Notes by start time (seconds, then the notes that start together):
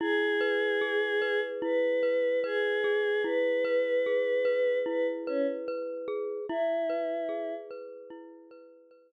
0.00 E4 G#4
0.41 B4
0.81 G#4
1.22 B4
1.62 E4 B4
2.03 B4
2.44 G#4 B4
2.84 G#4
3.24 E4 B4
3.65 B4
4.06 G#4
4.45 B4
4.86 E4 B4
5.27 C#4 B4
5.68 B4
6.08 G#4
6.49 E4
6.90 B4
7.29 G#4
7.71 B4
8.10 E4
8.51 B4
8.91 B4